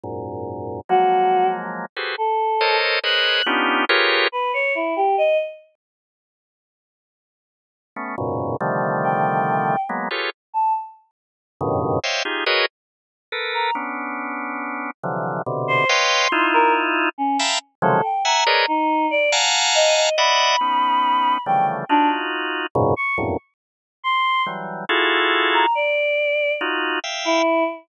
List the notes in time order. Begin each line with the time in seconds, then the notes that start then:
0.04 F#2 G#2 A#2
0.89 F3 F#3 G#3 A#3 F#4
1.96 F#4 G4 G#4 A4 B4 C5
2.18 A4
2.61 A4 A#4 C5 C#5 D#5
3.04 G#4 A#4 B4 C5 C#5 D#5 F#6
3.46 B3 C#4 D4 D#4 F4 G4
3.89 F4 G4 G#4 A#4 B4 C#5
4.32 B4
4.54 C#5
4.75 E4
4.96 G4
5.18 D#5
7.96 A3 B3 C#4
8.18 F#2 G#2 A#2 B2 C#3
8.61 C3 D3 D#3 F3 G3 A3
9.04 G5
9.89 F#3 G#3 A#3 B3
10.11 F4 G4 G#4 A4 B4 C#5
10.54 A5
11.61 F#2 G2 A2 B2 C#3 D#3
12.04 C5 C#5 D#5 E5 F5 G5
12.25 D#4 F4 G4 G#4
12.46 F#4 G#4 A#4 B4 C#5 D#5
13.32 A4 A#4 B4
13.54 A#5
13.75 B3 C#4 D4
15.03 C3 D3 E3 F3 F#3
15.46 B2 C3 D3
15.68 C5
15.89 B4 C#5 D#5 F5 G5 C6
16.32 D#4 E4 F4
16.54 A#4
17.18 C#4
17.39 E5 F5 G5 A5 A#5 B5
17.82 C3 C#3 D#3 F3 F#3 G#3 A4
18.04 G5
18.25 E5 F#5 G#5 A#5
18.47 G#4 A#4 B4 C#5 D5 D#5
18.68 D#4
19.11 D5
19.32 F5 F#5 G#5 A5 A#5
19.75 D#5
19.96 D#5
20.18 D5 D#5 E5 F#5 B5
20.61 B3 C#4 D#4
21.46 C#3 D3 E3 F3 G3 A3 G5
21.89 D4 D#4 F4 F#4
22.75 F#2 G#2 A#2 B2 C#3
22.96 C#6
23.18 E2 F2 F#2 G2 A2 A#2
24.04 C6
24.46 E3 F#3 G3
24.89 E4 F4 F#4 G#4 A4
25.54 A#5
25.75 D5
26.61 D#4 F4 F#4
27.04 E5 F5 G5
27.25 E4